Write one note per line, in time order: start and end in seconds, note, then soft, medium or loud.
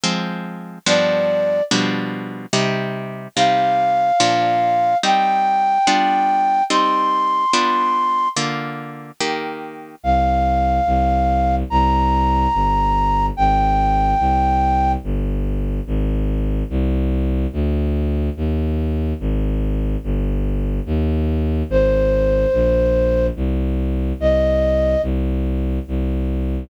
0.03 0.78 F3 loud
0.03 0.78 G#3 loud
0.03 0.78 C4 loud
0.86 1.61 G2 loud
0.86 1.61 F3 loud
0.86 1.61 B3 loud
0.86 1.61 D4 loud
0.86 1.63 D5 medium
1.71 2.46 B2 loud
1.71 2.46 F3 loud
1.71 2.46 G3 loud
1.71 2.46 D4 loud
2.53 3.28 C3 loud
2.53 3.28 G3 loud
2.53 3.28 D#4 loud
3.36 4.12 C3 loud
3.36 4.12 G3 loud
3.36 4.12 D#4 loud
3.36 4.97 F5 medium
4.20 4.95 A#2 loud
4.20 4.95 F3 loud
4.20 4.95 D4 loud
5.03 5.78 G3 loud
5.03 5.78 C4 loud
5.03 5.78 D#4 loud
5.03 6.64 G5 medium
5.87 6.62 G3 loud
5.87 6.62 B3 loud
5.87 6.62 D4 loud
5.87 6.62 F4 loud
6.70 7.45 G3 loud
6.70 7.45 C4 loud
6.70 7.45 D#4 loud
6.70 8.28 C6 medium
7.53 8.28 G3 loud
7.53 8.28 B3 loud
7.53 8.28 D4 loud
7.53 8.28 F4 loud
8.36 9.11 D3 loud
8.36 9.11 A#3 loud
8.36 9.11 F4 loud
9.20 9.95 D#3 loud
9.20 9.95 A#3 loud
9.20 9.95 G4 loud
10.03 10.80 C2 loud
10.03 11.55 F5 medium
10.86 11.63 C2 loud
11.70 12.47 C2 loud
11.70 13.26 A#5 medium
12.54 13.30 G1 loud
13.37 14.14 G#1 loud
13.37 14.92 G5 medium
14.19 14.96 C2 loud
15.04 15.80 G1 loud
15.87 16.63 G#1 loud
16.70 17.47 C2 loud
17.53 18.30 D2 loud
18.37 19.13 D#2 loud
19.20 19.97 G#1 loud
20.04 20.80 G1 loud
20.86 21.63 D#2 loud
21.69 22.46 G#1 loud
21.69 23.27 C5 medium
22.53 23.30 A#1 loud
23.36 24.13 C2 loud
24.19 24.96 C2 loud
24.19 25.02 D#5 medium
25.02 25.79 C2 loud
25.88 26.64 C2 loud